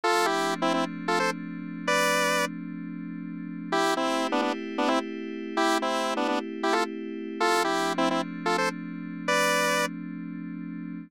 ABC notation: X:1
M:4/4
L:1/16
Q:1/4=130
K:Am
V:1 name="Lead 1 (square)"
[FA]2 [EG]3 [CE] [CE] z2 [FA] [Ac] z5 | [Bd]6 z10 | [EG]2 [CE]3 [B,D] [B,D] z2 [B,D] [CE] z5 | [EG]2 [CE]3 [B,D] [B,D] z2 [EG] [FA] z5 |
[FA]2 [EG]3 [CE] [CE] z2 [FA] [Ac] z5 | [Bd]6 z10 |]
V:2 name="Pad 5 (bowed)"
[F,A,CD]16- | [F,A,CD]16 | [A,CEG]16- | [A,CEG]16 |
[F,A,CD]16- | [F,A,CD]16 |]